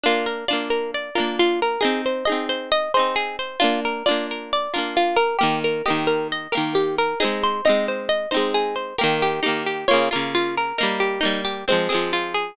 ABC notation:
X:1
M:4/4
L:1/8
Q:1/4=134
K:Bbmix
V:1 name="Acoustic Guitar (steel)"
F B d B d B F B | A c e c e c A c | F B d B d B F B | G B e B e B G B |
A c e c e c A c | [K:Ebmix] B G E G d B F B | B G E G c A F A |]
V:2 name="Acoustic Guitar (steel)"
[B,D]2 [B,DF]3 [B,DF]3 | [CE]2 [CEA]3 [CEA]3 | [B,D]2 [B,DF]3 [B,DF]3 | [E,B,]2 [E,B,G]3 [E,B,G]3 |
[A,CE]2 [A,CE]3 [A,CE]3 | [K:Ebmix] [E,B,G]2 [E,B,G]2 [D,B,F] [D,B,F]3 | [G,B,E]2 [G,B,]2 [F,A,C] [F,A,C]3 |]